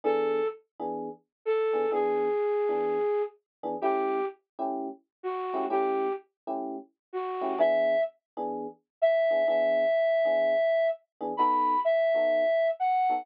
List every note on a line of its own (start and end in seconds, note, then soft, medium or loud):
0.04 0.41 E3 medium
0.04 0.41 B3 medium
0.04 0.41 D4 loud
0.04 0.41 G#4 medium
0.04 0.47 A4 medium
0.80 1.09 E3 medium
0.80 1.09 B3 medium
0.80 1.09 D4 medium
0.80 1.09 G#4 medium
1.45 1.91 A4 medium
1.73 1.86 E3 medium
1.73 1.86 B3 medium
1.73 1.86 D4 medium
1.73 1.86 G#4 medium
1.92 2.29 E3 medium
1.92 2.29 B3 loud
1.92 2.29 D4 medium
1.92 2.29 G#4 medium
1.92 3.22 G#4 medium
2.69 2.98 E3 medium
2.69 2.98 B3 medium
2.69 2.98 D4 medium
2.69 2.98 G#4 medium
3.63 3.76 E3 medium
3.63 3.76 B3 medium
3.63 3.76 D4 medium
3.63 3.76 G#4 medium
3.81 4.19 A3 medium
3.81 4.19 C#4 medium
3.81 4.19 E4 medium
3.81 4.25 G4 medium
3.81 4.19 G4 loud
4.59 4.88 A3 medium
4.59 4.88 C#4 medium
4.59 4.88 E4 medium
4.59 4.88 G4 medium
5.23 5.65 F#4 medium
5.54 5.66 A3 medium
5.54 5.66 C#4 medium
5.54 5.66 E4 medium
5.54 5.66 G4 medium
5.70 6.07 A3 medium
5.70 6.07 C#4 medium
5.70 6.07 E4 medium
5.70 6.07 G4 medium
5.70 6.13 G4 medium
6.47 6.77 A3 medium
6.47 6.77 C#4 medium
6.47 6.77 E4 medium
6.47 6.77 G4 medium
7.13 7.59 F#4 medium
7.41 7.54 A3 medium
7.41 7.54 C#4 medium
7.41 7.54 E4 medium
7.41 7.54 G4 medium
7.58 7.95 E3 medium
7.58 7.95 B3 loud
7.58 7.95 D4 loud
7.58 7.95 G#4 loud
7.58 8.01 E5 medium
8.37 8.66 E3 medium
8.37 8.66 B3 medium
8.37 8.66 D4 medium
8.37 8.66 G#4 medium
9.02 9.47 E5 medium
9.31 9.43 E3 medium
9.31 9.43 B3 medium
9.31 9.43 D4 medium
9.31 9.43 G#4 medium
9.48 9.85 E3 medium
9.48 9.85 B3 loud
9.48 9.85 D4 loud
9.48 9.85 G#4 medium
9.48 10.87 E5 medium
10.25 10.54 E3 medium
10.25 10.54 B3 medium
10.25 10.54 D4 medium
10.25 10.54 G#4 medium
11.21 11.33 E3 medium
11.21 11.33 B3 medium
11.21 11.33 D4 medium
11.21 11.33 G#4 medium
11.37 11.75 B3 medium
11.37 11.75 D#4 medium
11.37 11.75 F#4 medium
11.37 11.75 A4 medium
11.37 11.80 B5 medium
11.85 12.68 E5 medium
12.14 12.44 B3 medium
12.14 12.44 D#4 medium
12.14 12.44 F#4 medium
12.14 12.44 A4 medium
12.80 13.25 F#5 medium
13.09 13.22 B3 medium
13.09 13.22 D#4 medium
13.09 13.22 F#4 medium
13.09 13.22 A4 medium